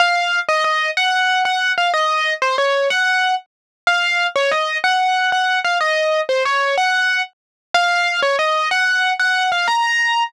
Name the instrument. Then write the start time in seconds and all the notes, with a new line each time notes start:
acoustic grand piano
0.00 F5
0.49 D#5
0.64 D#5
0.97 F#5
1.45 F#5
1.78 F5
1.94 D#5
2.42 C5
2.58 C#5
2.90 F#5
3.87 F5
4.36 C#5
4.51 D#5
4.84 F#5
5.32 F#5
5.65 F5
5.81 D#5
6.29 C5
6.45 C#5
6.78 F#5
7.74 F5
8.22 C#5
8.39 D#5
8.71 F#5
9.19 F#5
9.52 F5
9.68 A#5